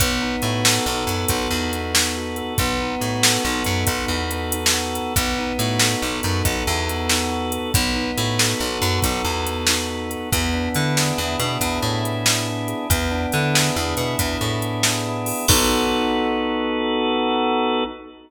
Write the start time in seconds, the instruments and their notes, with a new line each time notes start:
0.00 electric bass (finger) B1, drawbar organ B3, kick, closed hi-hat
0.21 drawbar organ D#4
0.42 electric bass (finger) A2, drawbar organ F#4, closed hi-hat
0.65 drawbar organ A4, snare
0.86 electric bass (finger) B1, drawbar organ B3
1.07 electric bass (finger) F#2, drawbar organ D#4, closed hi-hat
1.28 electric bass (finger) B1, drawbar organ F#4, kick, closed hi-hat
1.50 electric bass (finger) E2, drawbar organ A4
1.72 drawbar organ B3, closed hi-hat
1.93 drawbar organ D#4, snare
2.16 drawbar organ F#4
2.36 drawbar organ A4, closed hi-hat
2.58 electric bass (finger) B1, drawbar organ B3, kick, closed hi-hat
2.80 drawbar organ D#4
3.00 electric bass (finger) A2, drawbar organ F#4, closed hi-hat
3.22 drawbar organ A4, snare
3.44 electric bass (finger) B1, drawbar organ B3
3.64 electric bass (finger) F#2, drawbar organ D#4, closed hi-hat
3.86 electric bass (finger) B1, drawbar organ F#4, kick, closed hi-hat
4.08 electric bass (finger) E2, drawbar organ A4
4.31 drawbar organ B3, closed hi-hat
4.52 drawbar organ D#4, closed hi-hat
4.66 snare
4.73 drawbar organ F#4
4.95 drawbar organ A4, closed hi-hat
5.16 electric bass (finger) B1, drawbar organ B3, kick, closed hi-hat
5.38 drawbar organ D#4
5.59 electric bass (finger) A2, drawbar organ F#4, closed hi-hat
5.79 drawbar organ A4, snare
6.02 electric bass (finger) B1, drawbar organ B3
6.23 electric bass (finger) F#2, drawbar organ D#4, closed hi-hat
6.45 electric bass (finger) B1, drawbar organ F#4, kick, closed hi-hat
6.67 electric bass (finger) E2, drawbar organ A4
6.89 drawbar organ B3, closed hi-hat
7.09 drawbar organ D#4, snare
7.31 drawbar organ F#4
7.52 drawbar organ A4, closed hi-hat
7.74 electric bass (finger) B1, drawbar organ B3, kick, closed hi-hat
7.95 drawbar organ D#4
8.17 electric bass (finger) A2, drawbar organ F#4, closed hi-hat
8.39 drawbar organ A4, snare
8.60 electric bass (finger) B1, drawbar organ B3
8.82 electric bass (finger) F#2, drawbar organ D#4, closed hi-hat
9.02 electric bass (finger) B1, drawbar organ F#4, kick, closed hi-hat
9.24 electric bass (finger) E2, drawbar organ A4
9.47 drawbar organ B3, closed hi-hat
9.67 drawbar organ D#4, snare
9.89 drawbar organ F#4
10.10 drawbar organ A4, closed hi-hat
10.32 electric bass (finger) E2, drawbar organ B3, kick, closed hi-hat
10.53 drawbar organ D4
10.75 electric bass (finger) D3, drawbar organ E4, closed hi-hat
10.96 drawbar organ G#4, snare
11.18 electric bass (finger) E2, drawbar organ B3
11.40 electric bass (finger) B2, drawbar organ D4, closed hi-hat
11.61 electric bass (finger) E2, drawbar organ E4, kick, closed hi-hat
11.82 electric bass (finger) A2, drawbar organ G#4
12.03 drawbar organ B3, closed hi-hat
12.26 drawbar organ D4, snare
12.48 drawbar organ E4
12.68 drawbar organ G#4, closed hi-hat
12.90 electric bass (finger) E2, drawbar organ B3, kick, closed hi-hat
13.10 drawbar organ D4
13.32 electric bass (finger) D3, drawbar organ E4, closed hi-hat
13.54 drawbar organ G#4, snare
13.76 electric bass (finger) E2, drawbar organ B3
13.97 electric bass (finger) B2, drawbar organ D4, closed hi-hat
14.19 electric bass (finger) E2, drawbar organ E4, kick, closed hi-hat
14.41 electric bass (finger) A2, drawbar organ G#4
14.62 drawbar organ B3, closed hi-hat
14.83 drawbar organ D4, snare
15.06 drawbar organ E4
15.26 drawbar organ G#4, open hi-hat
15.48 electric bass (finger) B1, drawbar organ B3 D#4 F#4 A4, kick, crash